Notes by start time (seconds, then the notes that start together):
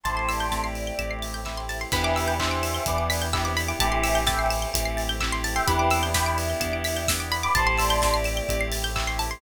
0.03 A1 A3 C4 E4 G4 A4 C5 E5 G5 A5 C6, kick, closed hi-hat
0.16 A5 C6
0.29 D5 E6, open hi-hat
0.40 G6
0.51 A3 C4 E4 G4 A6, kick, snare
0.64 C7
0.75 E7, open hi-hat
0.87 G7
0.98 A1 A3 C4 E4 G4 E7, kick, closed hi-hat
1.11 C7
1.22 A6, open hi-hat
1.34 G6
1.45 A3 C4 E4 G4 E6, kick, clap
1.57 C6
1.69 A5, open hi-hat
1.81 C6
1.92 E2 C3 E3 B3 D4 E4 G4 B4 D5 E5 G5 B5, kick, crash
2.04 D6
2.16 E6, open hi-hat
2.28 G6
2.39 E3 B3 D4 E4 G4 C5 E5 B6, kick, clap
2.51 D7
2.63 E7, open hi-hat
2.75 G7
2.86 E2 B3 D4 E4 G4 B4 D5 E7, kick, closed hi-hat
2.98 D7
3.10 B6, open hi-hat
3.22 G6
3.32 B3 D4 E4 G4 E6, kick, clap
3.45 C4 E4 D6
3.57 B5, open hi-hat
3.68 E4 G4 D6
3.79 A1 C3 E3 A3 C4 E4 G4 A4 C5 E5 G5 A5, kick, closed hi-hat
3.92 C6
4.03 E6, open hi-hat
4.15 G6
4.26 E3 A3 C4 E4 G4 E5 G5 A6, kick, snare
4.39 C7
4.50 E7, open hi-hat
4.62 G7
4.73 A1 A3 C4 E4 G4 E7, kick, closed hi-hat
4.85 C7
4.97 A6, open hi-hat
5.09 G6
5.20 A3 C4 E4 G4 E6, kick, clap
5.32 C6
5.44 A5, open hi-hat
5.55 E5 G5 C6
5.66 E2 B3 C4 D4 E4 G4 B4 D5 E5 G5 B5, kick, closed hi-hat
5.79 D6
5.91 E6, open hi-hat
6.03 G6
6.14 B3 D4 E4 G4 G5 B5 B6, kick, snare
6.26 D7
6.38 E7, open hi-hat
6.50 G7
6.60 E2 B3 D4 E4 G4 E7, kick, closed hi-hat
6.73 D7
6.84 B6, open hi-hat
6.96 G6
7.08 B3 D4 E4 G4 E6, kick, snare
7.20 D6
7.32 B5, open hi-hat
7.43 B5 D6
7.54 A1 A3 C4 E4 G4 A4 C5 E5 G5 A5 C6, kick, closed hi-hat
7.67 A5 C6
7.78 D5 E6, open hi-hat
7.90 G6
8.02 A3 C4 E4 G4 A6, kick, snare
8.14 C7
8.24 E7, open hi-hat
8.37 G7
8.48 A1 A3 C4 E4 G4 E7, kick, closed hi-hat
8.61 C7
8.72 A6, open hi-hat
8.84 G6
8.95 A3 C4 E4 G4 E6, kick, clap
9.07 C6
9.19 A5, open hi-hat
9.31 C6